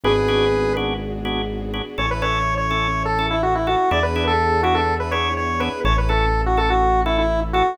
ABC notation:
X:1
M:4/4
L:1/16
Q:1/4=124
K:A
V:1 name="Lead 1 (square)"
[GB]6 z10 | c B c3 c4 A2 E F E F2 | d B2 A3 F A2 B c2 c2 B2 | c B A3 F A F3 E E2 z F2 |]
V:2 name="Drawbar Organ"
[B,DFG]2 [B,DFG]4 [B,DFG]4 [B,DFG]4 [B,DFG]2 | [CEA]2 [CEA]4 [CEA]4 [CEA]4 [CEA]2 | [B,DEG]2 [B,DEG]4 [B,DEG]4 [B,DEG]4 [B,DEG]2 | [CEA]2 [CEA]4 [CEA]4 [CEA]4 [CEA]2 |]
V:3 name="Synth Bass 1" clef=bass
G,,,16 | A,,,16 | E,,16 | A,,,16 |]
V:4 name="String Ensemble 1"
[B,DFG]16 | [CEA]16 | [B,DEG]16 | [CEA]16 |]